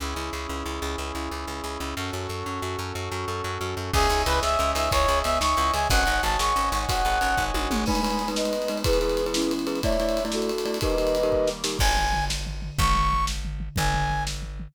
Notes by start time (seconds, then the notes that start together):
0.00 C#2 C#4 E4 G#4
0.16 C#2 E4
0.33 C#2 G#4
0.49 C#2 C#4
0.65 C#2 E4
0.82 C#2 G#4
0.98 C#2 C#4
1.15 C#2 E4
1.31 C#2 G#4
1.47 C#2 C#4
1.64 C#2 E4
1.80 C#2 C#4
1.97 F#2 C#4 F#4 A4
2.13 F#2 F#4
2.29 F#2 A4
2.46 F#2 C#4
2.62 F#2 F#4
2.78 F#2 A4
2.95 F#2 C#4
3.12 F#2 F#4
3.28 F#2 A4
3.44 F#2 C#4
3.61 F#2 F#4
3.77 F#2 A4
3.93 C#2 C#4 G#4 C#5 D#5 E5 G#5, kick, crash
4.10 C#2 D#4, ride
4.26 C#2 E4 B4, ride
4.42 C#2 G#4 E5, snare
4.59 C#2 C#4, ride
4.75 C#2 D#4 E5, ride
4.91 C#2 E4 C#5, kick, ride
5.08 C#2 G#4, ride
5.24 C#2 B3 E5, ride
5.41 C#2 D#4 C#6, snare
5.57 C#2 E4, ride
5.74 C#2 G#4 G#5, ride
5.90 G#1 C#4 C#5 D#5 F#5 G#5, kick, ride
6.06 G#1 D#4, ride
6.23 G#1 F#4 A5, ride
6.39 G#1 G#4 C#6, snare
6.56 G#1 C#4, ride
6.72 G#1 D#4 C#6, ride
6.88 G#1 F#4 F#5, kick, ride
7.05 G#1 G#4, ride
7.21 G#1 C#4, ride
7.37 G#1 D#4, kick
7.54 G#1 F#4, high tom
7.71 G#1 G#4, mid tom
7.86 G#3 B3 D#4 B4 G#5 B5, kick, crash
7.95 ride
8.03 G#3 D#4 B4, ride
8.10 ride
8.19 ride
8.28 G#3 D#4 B4, ride
8.36 B4 D#5, snare
8.45 ride
8.53 ride
8.62 ride
8.68 G#3 D#4 B4, ride
8.77 ride
8.84 E3 G#3 B3 E4 G#4 B4, kick, ride
8.93 ride
9.01 E4 G#4 B4, ride
9.09 ride
9.17 ride
9.26 E4 G#4 B4, ride
9.34 C#4 E4, snare
9.42 ride
9.51 ride
9.59 ride
9.67 E4 G#4 B4, ride
9.75 ride
9.83 A3 D4 E4 C#5 D5 E5, kick, ride
9.92 ride
10.00 A3 E4 D5, ride
10.09 ride
10.17 ride
10.25 A3 E4 D5, ride
10.32 F#4 A4, snare
10.42 ride
10.49 ride
10.58 ride
10.65 A3 E4 D5, ride
10.74 ride
10.81 D#3 G3 A#3 D#4 G4 A#4 B4 D#5, kick, ride
10.90 ride
10.98 D#4 G4 A#4, ride
11.07 ride
11.15 ride
11.23 D#4 G4 A#4, ride
11.32 kick
11.47 snare
11.64 D#4 G4 A#4, snare
11.79 G#1 G#5, kick, crash
11.97 floor tom
12.13 floor tom
12.30 snare
12.46 floor tom
12.62 floor tom
12.78 G#1 C#6, kick, floor tom
12.95 floor tom
13.12 floor tom
13.27 snare
13.45 floor tom
13.60 floor tom
13.76 G#1 G#5, kick, floor tom
13.94 floor tom
14.10 floor tom
14.27 snare
14.42 floor tom
14.60 floor tom